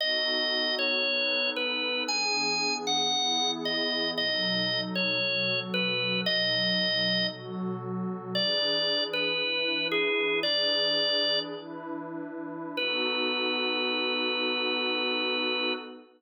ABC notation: X:1
M:4/4
L:1/8
Q:1/4=115
K:B
V:1 name="Drawbar Organ"
d3 c3 B2 | g3 f3 d2 | d3 c3 B2 | d4 z4 |
=d3 B3 G2 | "^rit." =d4 z4 | B8 |]
V:2 name="Pad 2 (warm)"
[B,DF=A]4 [B,DAB]4 | [E,B,=DG]4 [E,B,EG]4 | [B,,F,D=A]4 [B,,F,FA]4 | [B,,F,D=A]4 [B,,F,FA]4 |
[E,=DGB]4 [E,DEB]4 | "^rit." [E,=DGB]4 [E,DEB]4 | [B,DF=A]8 |]